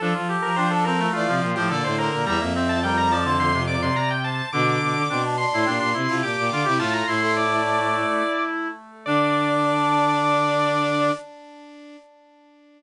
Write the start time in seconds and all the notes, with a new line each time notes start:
0.00 F3 D4 A4
0.14 F3 F4
0.29 G4
0.42 F3 A#4
0.54 F3 D4 G4 C5
0.71 A4
0.84 C4 A4 A#4
0.99 A3
1.13 E3 A3 F4 D5
1.27 C3 F3
1.42 A#2 F4
1.55 A2 F3 G4 C5
1.69 A#2 D3 A4 D5
1.84 A2 C5
1.98 A#4 C5
2.11 A#2 A#4
2.25 E2 G3 E5 A#5
2.40 F2 A#3
2.53 C4 E5
2.69 A5
2.83 G3 A#4 G5
2.98 A#5
3.10 F3 D5 A5
3.25 D3 C5
3.38 D3 C6
3.54 C3
3.67 D5 D6
3.82 C3 C6
3.96 C3 A#5
4.11 G5
4.24 C5 A5
4.53 B2 D3 D4 D6
4.81 B2
4.95 D3
5.09 B2 C4 D4
5.24 D4
5.37 D4 C6
5.52 A2 E4
5.64 A#2 D4 G4
5.79 A#2 D4
5.94 C3 E4
6.08 C3 E4 F4
6.22 A#2 G4 D6
6.37 A#2
6.50 D3 F4
6.65 C3 E4 G4
6.79 A2 A3 F4 A5
6.93 F4 A#5
7.07 A2 A3 E4 C6
7.21 A3 C6
7.36 D5
9.06 D3 D4 D5